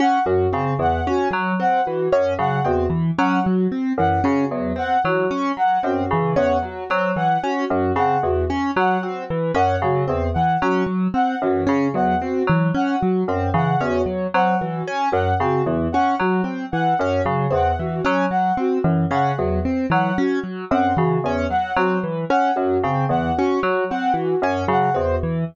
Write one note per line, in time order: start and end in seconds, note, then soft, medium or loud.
0.00 0.19 C#4 medium
0.00 0.22 F#5 medium
0.26 0.47 F#2 medium
0.26 0.47 F#3 medium
0.26 0.49 F#4 medium
0.53 0.75 C#3 medium
0.53 0.74 C4 medium
0.79 1.01 E2 medium
0.79 1.00 E3 medium
0.79 1.02 F#5 medium
1.07 1.28 C#4 medium
1.07 1.28 F#4 medium
1.31 1.52 F#3 medium
1.31 1.54 F#3 medium
1.60 1.81 C4 medium
1.60 1.82 F#5 medium
1.85 2.08 E3 medium
1.85 2.07 F#4 medium
2.12 2.34 F#2 medium
2.12 2.34 C#4 medium
2.39 2.60 C#3 medium
2.39 2.60 F#3 medium
2.39 2.60 F#5 medium
2.64 2.87 E2 medium
2.64 2.86 C4 medium
2.64 2.86 F#4 medium
2.90 3.11 E3 medium
3.18 3.40 F#3 medium
3.18 3.40 C#4 medium
3.18 3.39 F#5 medium
3.43 3.67 F#3 medium
3.43 3.64 F#4 medium
3.72 3.93 C4 medium
3.98 4.19 F#2 medium
3.98 4.20 E3 medium
3.98 4.19 F#5 medium
4.24 4.46 C#3 medium
4.24 4.45 C#4 medium
4.24 4.45 F#4 medium
4.51 4.72 E2 medium
4.51 4.73 F#3 medium
4.76 4.97 C4 medium
4.76 4.99 F#5 medium
5.04 5.26 E3 medium
5.04 5.26 F#3 medium
5.04 5.26 F#4 medium
5.31 5.52 C#4 medium
5.57 5.78 F#3 medium
5.57 5.79 F#5 medium
5.83 6.05 F#2 medium
5.83 6.04 C4 medium
5.83 6.06 F#4 medium
6.11 6.32 C#3 medium
6.11 6.34 E3 medium
6.36 6.58 E2 medium
6.36 6.57 C#4 medium
6.36 6.57 F#5 medium
6.62 6.84 F#3 medium
6.62 6.85 F#4 medium
6.90 7.12 F#3 medium
6.90 7.11 C4 medium
7.16 7.38 E3 medium
7.16 7.38 F#5 medium
7.43 7.65 C#4 medium
7.43 7.64 F#4 medium
7.70 7.91 F#2 medium
7.70 7.92 F#3 medium
7.96 8.17 C#3 medium
7.96 8.17 C4 medium
7.96 8.18 F#5 medium
8.23 8.44 E2 medium
8.23 8.45 E3 medium
8.23 8.44 F#4 medium
8.50 8.71 C#4 medium
8.76 8.98 F#3 medium
8.76 8.98 F#5 medium
9.01 9.24 C4 medium
9.01 9.22 F#4 medium
9.30 9.52 E3 medium
9.54 9.77 F#2 medium
9.54 9.76 C#4 medium
9.54 9.78 F#5 medium
9.82 10.03 C#3 medium
9.82 10.05 F#3 medium
9.82 10.03 F#4 medium
10.08 10.30 E2 medium
10.08 10.29 C4 medium
10.34 10.57 E3 medium
10.34 10.55 F#5 medium
10.61 10.83 F#3 medium
10.61 10.83 C#4 medium
10.61 10.83 F#4 medium
10.86 11.08 F#3 medium
11.14 11.35 C4 medium
11.14 11.35 F#5 medium
11.42 11.63 F#2 medium
11.42 11.64 E3 medium
11.42 11.63 F#4 medium
11.67 11.90 C#3 medium
11.67 11.88 C#4 medium
11.94 12.16 E2 medium
11.94 12.15 F#3 medium
11.94 12.16 F#5 medium
12.21 12.43 C4 medium
12.21 12.43 F#4 medium
12.47 12.71 E3 medium
12.47 12.68 F#3 medium
12.74 12.96 C#4 medium
12.74 12.96 F#5 medium
13.00 13.24 F#3 medium
13.00 13.21 F#4 medium
13.28 13.49 F#2 medium
13.28 13.50 C4 medium
13.54 13.75 C#3 medium
13.54 13.75 E3 medium
13.54 13.77 F#5 medium
13.80 14.02 E2 medium
13.80 14.02 C#4 medium
13.80 14.03 F#4 medium
14.06 14.27 F#3 medium
14.34 14.56 F#3 medium
14.34 14.56 C4 medium
14.34 14.55 F#5 medium
14.61 14.82 E3 medium
14.61 14.82 F#4 medium
14.87 15.09 C#4 medium
15.12 15.34 F#2 medium
15.12 15.33 F#3 medium
15.12 15.33 F#5 medium
15.40 15.61 C#3 medium
15.40 15.62 C4 medium
15.40 15.62 F#4 medium
15.66 15.87 E2 medium
15.66 15.88 E3 medium
15.92 16.15 C#4 medium
15.92 16.13 F#5 medium
16.19 16.41 F#3 medium
16.19 16.42 F#3 medium
16.19 16.40 F#4 medium
16.44 16.65 C4 medium
16.72 16.94 E3 medium
16.72 16.93 F#5 medium
16.99 17.21 F#2 medium
16.99 17.22 C#4 medium
16.99 17.22 F#4 medium
17.25 17.47 C#3 medium
17.25 17.47 F#3 medium
17.50 17.73 E2 medium
17.50 17.72 C4 medium
17.50 17.75 F#5 medium
17.79 18.01 E3 medium
17.79 18.01 F#4 medium
18.05 18.27 F#3 medium
18.05 18.26 C#4 medium
18.31 18.52 F#3 medium
18.31 18.52 F#5 medium
18.57 18.79 C4 medium
18.57 18.80 F#4 medium
18.84 19.05 F#2 medium
18.84 19.06 E3 medium
19.11 19.32 C#3 medium
19.11 19.32 C#4 medium
19.11 19.32 F#5 medium
19.37 19.60 E2 medium
19.37 19.60 F#3 medium
19.37 19.59 F#4 medium
19.65 19.86 C4 medium
19.90 20.11 E3 medium
19.90 20.13 F#3 medium
19.90 20.12 F#5 medium
20.17 20.39 C#4 medium
20.17 20.38 F#4 medium
20.44 20.65 F#3 medium
20.71 20.92 F#2 medium
20.71 20.93 C4 medium
20.71 20.92 F#5 medium
20.96 21.19 C#3 medium
20.96 21.18 E3 medium
20.96 21.17 F#4 medium
21.24 21.45 E2 medium
21.24 21.47 C#4 medium
21.49 21.72 F#3 medium
21.49 21.71 F#5 medium
21.76 21.98 F#3 medium
21.76 21.98 C4 medium
21.76 21.97 F#4 medium
22.04 22.25 E3 medium
22.30 22.51 C#4 medium
22.30 22.51 F#5 medium
22.56 22.78 F#2 medium
22.56 22.77 F#3 medium
22.56 22.79 F#4 medium
22.84 23.05 C#3 medium
22.84 23.06 C4 medium
23.09 23.30 E2 medium
23.09 23.32 E3 medium
23.09 23.31 F#5 medium
23.36 23.60 C#4 medium
23.36 23.58 F#4 medium
23.63 23.84 F#3 medium
23.90 24.12 C4 medium
23.90 24.11 F#5 medium
24.14 24.35 E3 medium
24.14 24.36 F#4 medium
24.42 24.63 F#2 medium
24.42 24.64 C#4 medium
24.68 24.90 C#3 medium
24.68 24.89 F#3 medium
24.68 24.92 F#5 medium
24.94 25.17 E2 medium
24.94 25.16 C4 medium
24.94 25.16 F#4 medium
25.23 25.44 E3 medium